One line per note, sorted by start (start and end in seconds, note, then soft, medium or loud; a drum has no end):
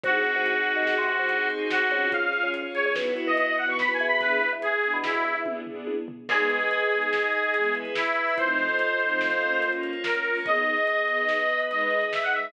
0.03 0.23 C2 medium
0.03 0.33 C4 medium
0.03 1.07 C4 medium
0.03 1.07 D#4 medium
0.03 0.33 D#4 medium
0.03 1.07 F#4 loud
0.03 1.48 F#4 medium
0.03 0.33 F#4 medium
0.03 1.07 G#4 medium
0.03 kick loud
0.03 closed hi-hat loud
0.08 0.33 G#4 medium
0.25 closed hi-hat medium
0.36 0.55 C2 medium
0.46 closed hi-hat loud
0.66 0.95 C4 medium
0.66 0.95 D#4 medium
0.66 0.95 F#4 medium
0.66 0.95 G#4 medium
0.66 closed hi-hat medium
0.76 0.95 D#2 medium
0.87 snare loud
0.98 1.07 C3 medium
1.07 1.17 C3 medium
1.07 2.11 C4 medium
1.07 2.11 D#4 medium
1.07 2.11 G#4 medium
1.07 2.11 C5 medium
1.07 closed hi-hat medium
1.19 1.38 C2 medium
1.29 closed hi-hat loud
1.50 1.79 C4 medium
1.50 1.79 D#4 medium
1.50 1.79 F#4 medium
1.50 1.79 G#4 medium
1.50 closed hi-hat medium
1.70 2.11 F#4 medium
1.70 snare loud
1.91 2.31 C#2 medium
1.91 2.27 C#4 medium
1.91 2.27 F4 medium
1.91 2.27 G#4 medium
1.91 closed hi-hat medium
2.11 2.53 C#4 medium
2.11 2.53 F4 medium
2.11 2.53 G#4 medium
2.11 2.49 F5 medium
2.11 kick loud
2.11 closed hi-hat loud
2.33 2.63 C#4 medium
2.33 2.63 F4 medium
2.33 2.63 G#4 medium
2.33 closed hi-hat medium
2.43 2.62 C#2 medium
2.54 2.95 C#4 medium
2.54 2.95 G#4 medium
2.54 2.95 C#5 medium
2.54 closed hi-hat loud
2.75 2.89 C#4 medium
2.75 2.89 F4 medium
2.75 2.89 G#4 medium
2.75 2.84 C#5 medium
2.75 closed hi-hat medium
2.85 2.95 C#2 medium
2.85 2.95 C#5 medium
2.96 3.14 B1 medium
2.96 3.25 B3 medium
2.96 3.59 B3 medium
2.96 3.59 E4 loud
2.96 3.25 E4 loud
2.96 3.59 F#4 medium
2.96 3.25 F#4 medium
2.96 snare loud
3.17 closed hi-hat medium
3.27 3.46 B1 medium
3.27 3.37 D#5 medium
3.37 3.47 D#5 medium
3.37 closed hi-hat loud
3.47 3.57 D#5 medium
3.58 3.87 B3 medium
3.58 4.22 B3 medium
3.58 3.87 E4 medium
3.58 4.22 F#4 medium
3.58 3.87 F#4 medium
3.58 4.22 B4 medium
3.58 3.68 F#5 medium
3.58 closed hi-hat medium
3.69 3.87 B1 medium
3.69 3.79 C#6 medium
3.79 3.92 B5 medium
3.79 snare loud
3.89 3.98 B1 medium
3.93 4.06 G#5 medium
4.00 4.40 E2 medium
4.00 closed hi-hat medium
4.07 4.20 B5 medium
4.21 4.50 B3 loud
4.21 4.50 D4 medium
4.21 4.50 E4 medium
4.21 4.50 G#4 medium
4.21 4.50 B4 loud
4.21 kick loud
4.21 closed hi-hat loud
4.41 closed hi-hat medium
4.53 4.71 E2 medium
4.62 4.97 G#4 medium
4.62 closed hi-hat loud
4.83 5.13 B3 medium
4.83 5.13 D4 medium
4.83 5.13 E4 medium
4.83 5.13 G#4 medium
4.83 closed hi-hat medium
4.93 5.12 B2 medium
5.04 5.38 E4 medium
5.04 snare loud
5.14 5.23 B2 medium
5.24 5.34 E2 medium
5.24 closed hi-hat medium
5.35 5.53 E2 medium
5.46 5.60 B3 medium
5.46 5.60 D4 medium
5.46 5.60 E4 medium
5.46 5.60 G#4 medium
5.46 kick medium
5.46 high tom medium
5.66 5.95 B3 medium
5.66 5.95 D4 medium
5.66 5.95 E4 medium
5.66 5.95 G#4 medium
5.66 floor tom medium
5.87 high tom medium
6.08 floor tom loud
6.29 6.58 G#3 medium
6.29 6.58 B3 medium
6.29 6.58 D#4 medium
6.29 7.75 G#4 medium
6.29 6.91 G#4 medium
6.29 6.91 B4 medium
6.29 6.91 D#5 medium
6.29 kick loud
6.29 crash loud
6.39 closed hi-hat medium
6.50 closed hi-hat medium
6.60 closed hi-hat medium
6.71 closed hi-hat loud
6.81 closed hi-hat medium
6.91 7.20 G#3 medium
6.91 7.20 B3 medium
6.91 7.54 D#4 medium
6.91 7.20 D#4 medium
6.91 7.54 G#4 medium
6.91 7.54 D#5 medium
6.91 closed hi-hat medium
7.02 closed hi-hat medium
7.13 snare loud
7.23 closed hi-hat medium
7.33 closed hi-hat medium
7.44 closed hi-hat medium
7.54 7.84 E3 medium
7.54 7.84 G#3 medium
7.54 7.84 B3 medium
7.54 7.95 E4 medium
7.54 7.96 G#4 medium
7.54 7.95 B4 medium
7.54 closed hi-hat loud
7.64 closed hi-hat medium
7.75 closed hi-hat medium
7.85 closed hi-hat medium
7.95 8.37 E4 medium
7.95 8.35 E4 medium
7.95 8.37 B4 medium
7.95 8.37 E5 medium
7.95 snare loud
8.06 closed hi-hat medium
8.16 closed hi-hat medium
8.27 open hi-hat medium
8.38 8.67 F3 medium
8.38 8.67 A3 medium
8.38 8.67 C4 medium
8.38 8.67 D#4 medium
8.38 8.99 F4 medium
8.38 8.99 A4 medium
8.38 9.71 C5 medium
8.38 9.01 C5 medium
8.38 8.99 D#5 medium
8.38 kick loud
8.38 closed hi-hat loud
8.48 closed hi-hat medium
8.58 closed hi-hat medium
8.69 closed hi-hat medium
8.79 closed hi-hat loud
8.89 closed hi-hat medium
9.00 9.29 F3 medium
9.00 9.29 A3 medium
9.00 9.29 C4 medium
9.00 9.29 D#4 medium
9.00 9.62 F4 medium
9.00 9.62 A4 medium
9.00 9.62 D#5 medium
9.00 9.62 F5 medium
9.00 closed hi-hat medium
9.10 closed hi-hat medium
9.21 snare loud
9.31 closed hi-hat medium
9.41 9.91 A#3 medium
9.41 9.91 C#4 medium
9.41 9.91 F4 medium
9.41 closed hi-hat medium
9.52 closed hi-hat medium
9.62 10.03 A#3 medium
9.62 10.04 F4 medium
9.62 10.03 C#5 medium
9.62 closed hi-hat loud
9.73 closed hi-hat medium
9.83 closed hi-hat medium
9.93 closed hi-hat medium
10.04 10.45 A#3 medium
10.04 10.45 C#4 medium
10.04 10.38 A#4 medium
10.04 10.45 C#5 medium
10.04 snare loud
10.14 closed hi-hat medium
10.25 10.39 A#3 medium
10.25 10.39 C#4 medium
10.25 10.39 F4 medium
10.25 closed hi-hat medium
10.35 open hi-hat medium
10.45 10.75 B3 loud
10.45 11.08 B3 medium
10.45 10.75 D#4 medium
10.45 11.08 G#4 medium
10.45 10.75 G#4 medium
10.45 11.08 D#5 medium
10.45 11.61 D#5 medium
10.45 kick loud
10.45 closed hi-hat medium
10.56 closed hi-hat medium
10.66 closed hi-hat medium
10.77 closed hi-hat medium
10.87 closed hi-hat loud
10.97 closed hi-hat medium
11.08 11.37 B3 medium
11.08 11.70 B3 medium
11.08 11.37 D#4 medium
11.08 11.37 G#4 medium
11.08 11.69 B4 medium
11.08 11.69 D#5 medium
11.08 closed hi-hat medium
11.18 closed hi-hat medium
11.29 snare loud
11.39 closed hi-hat medium
11.49 closed hi-hat medium
11.60 closed hi-hat medium
11.70 11.99 G#3 medium
11.70 11.99 D#4 medium
11.70 12.11 G#4 medium
11.70 12.11 B4 medium
11.70 11.99 B4 loud
11.70 12.11 D#5 medium
11.70 12.05 D#5 medium
11.70 closed hi-hat medium
11.81 closed hi-hat medium
11.91 closed hi-hat medium
12.02 closed hi-hat medium
12.12 12.52 D#4 medium
12.12 12.52 G#4 medium
12.12 12.52 D#5 medium
12.12 12.22 E5 medium
12.12 snare loud
12.23 12.33 F#5 medium
12.23 closed hi-hat medium
12.33 12.48 G#3 medium
12.33 12.48 D#4 medium
12.33 12.48 B4 medium
12.33 12.52 E5 medium
12.33 closed hi-hat medium
12.44 closed hi-hat medium